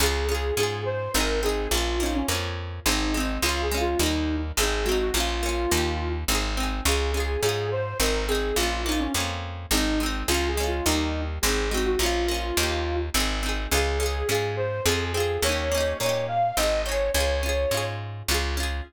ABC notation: X:1
M:3/4
L:1/16
Q:1/4=105
K:Db
V:1 name="Flute"
A2 A2 A2 c2 B2 A2 | F2 E D z4 E2 z2 | (3F2 A2 F2 E3 z A2 G G | F8 z4 |
A2 A2 A2 c2 B2 A2 | F2 E D z4 E2 z2 | (3F2 A2 F2 E3 z A2 G G | F8 z4 |
A2 A2 A2 c2 A2 A2 | d2 d2 d2 f2 e2 d2 | d6 z6 |]
V:2 name="Pizzicato Strings"
[DFA]2 [DFA]2 [DFA]4 [CEA]2 [CEA]2 | [B,DF]2 [B,DF]2 [B,DF]4 [A,CE]2 [A,CE]2 | [A,DF]2 [A,DF]2 [=G,B,E]4 [A,CE]2 [A,CE]2 | [B,DF]2 [B,DF]2 [B,E=G]4 [CEA]2 [CEA]2 |
[DFA]2 [DFA]2 [DFA]4 [CEA]2 [CEA]2 | [B,DF]2 [B,DF]2 [B,DF]4 [A,CE]2 [A,CE]2 | [A,DF]2 [A,DF]2 [=G,B,E]4 [A,CE]2 [A,CE]2 | [B,DF]2 [B,DF]2 [B,E=G]4 [CEA]2 [CEA]2 |
[DFA]2 [DFA]2 [DFA]4 [CFA]2 [CFA]2 | [B,DE=G]2 [B,DEG]2 [B,DEG]4 [CEA]2 [CEA]2 | [DFA]2 [DFA]2 [DFA]4 [DFA]2 [DFA]2 |]
V:3 name="Electric Bass (finger)" clef=bass
D,,4 A,,4 A,,,4 | B,,,4 F,,4 A,,,4 | D,,4 E,,4 A,,,4 | B,,,4 E,,4 A,,,4 |
D,,4 A,,4 A,,,4 | B,,,4 F,,4 A,,,4 | D,,4 E,,4 A,,,4 | B,,,4 E,,4 A,,,4 |
D,,4 A,,4 F,,4 | E,,4 B,,4 A,,,4 | D,,4 A,,4 D,,4 |]